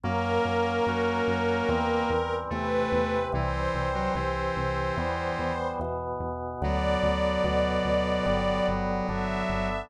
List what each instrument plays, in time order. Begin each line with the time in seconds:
0.04 synth bass 1 F#2, drawbar organ F#3 A#3 C#4, lead 1 (square) A#3, string ensemble 1 A#4
0.45 synth bass 1 F#2
0.87 synth bass 1 F#2, drawbar organ F#3 C#4 F#4
1.27 synth bass 1 F#2
1.69 synth bass 1 E2, drawbar organ E3 G3 C4
2.10 synth bass 1 E2
2.50 synth bass 1 E2, drawbar organ C3 E3 C4, lead 1 (square) A3, string ensemble 1 B4
2.92 synth bass 1 E2
3.32 synth bass 1 C2, drawbar organ E3 G3 C4, lead 1 (square) E3, string ensemble 1 C5
3.74 synth bass 1 C2
3.95 lead 1 (square) F#3
4.15 synth bass 1 C2, drawbar organ C3 E3 C4, lead 1 (square) E3
4.56 synth bass 1 C2
4.97 synth bass 1 E2, drawbar organ E3 G3 B3
5.39 synth bass 1 E2
5.80 synth bass 1 E2, drawbar organ B2 E3 B3
6.20 synth bass 1 E2
6.61 synth bass 1 D2, drawbar organ D3 F#3 B3, lead 1 (square) F#3, string ensemble 1 D5
7.03 synth bass 1 D2
7.44 synth bass 1 D2, drawbar organ B2 D3 B3
7.85 synth bass 1 D2
8.26 synth bass 1 G1, drawbar organ D3 G3 B3
8.68 synth bass 1 G1
9.09 synth bass 1 G1, drawbar organ D3 B3 D4, string ensemble 1 E5
9.49 synth bass 1 G1